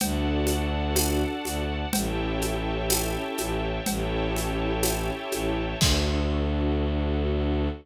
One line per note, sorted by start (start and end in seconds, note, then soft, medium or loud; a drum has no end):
0.00 1.25 D2 medium
0.00 1.74 D4 loud
0.00 1.74 F#4 loud
0.00 1.74 A4 loud
0.00 1.90 D5 loud
0.00 1.90 F#5 loud
0.00 1.90 A5 medium
0.00 cowbell medium
0.00 low conga loud
0.00 shaker medium
0.47 high conga medium
0.47 shaker medium
0.96 tambourine medium
0.96 cowbell medium
0.96 high conga loud
0.96 shaker medium
1.44 1.85 D2 medium
1.44 high conga medium
1.44 shaker medium
1.92 3.17 A1 medium
1.92 3.68 C#4 loud
1.92 3.68 E4 loud
1.92 3.68 G4 loud
1.92 3.68 A4 loud
1.92 3.84 C#5 medium
1.92 3.84 E5 loud
1.92 3.84 G5 loud
1.92 3.84 A5 medium
1.92 cowbell loud
1.92 low conga loud
1.92 shaker medium
2.42 high conga medium
2.42 shaker medium
2.90 tambourine medium
2.90 cowbell medium
2.90 high conga medium
2.90 shaker medium
3.38 3.80 A1 medium
3.38 high conga medium
3.38 shaker medium
3.86 5.10 A1 medium
3.86 5.61 C#4 loud
3.86 5.61 E4 loud
3.86 5.61 G4 loud
3.86 5.61 A4 loud
3.86 5.78 C#5 loud
3.86 5.78 E5 medium
3.86 5.78 G5 medium
3.86 5.78 A5 medium
3.86 cowbell medium
3.86 low conga loud
3.86 shaker medium
4.36 high conga medium
4.36 shaker medium
4.83 tambourine medium
4.83 cowbell medium
4.83 high conga medium
4.83 shaker medium
5.32 5.75 A1 medium
5.32 high conga medium
5.32 shaker medium
5.80 7.68 D2 loud
5.80 7.69 D4 loud
5.80 7.69 F#4 loud
5.80 7.69 A4 loud
5.80 kick loud
5.80 crash loud